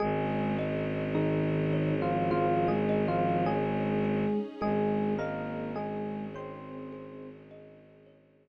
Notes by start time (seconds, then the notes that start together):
0.00 G#1 G#3 C#4 D#4 G#4
0.58 D#5
1.15 D#3 D#4 G#4
1.73 C#5
2.02 F3 F4
2.31 F3 F4 G#4
2.68 G#3 G#4
2.89 D#5
3.08 F3 F4
3.46 G#3 G#4 C#5
4.04 G#4
4.61 G#1 G#3 G#4
5.19 A#3 A#4 D#5
5.76 G#3 G#4
6.34 C4 C5 C#5
6.93 G#4
7.51 D#5
8.06 C#5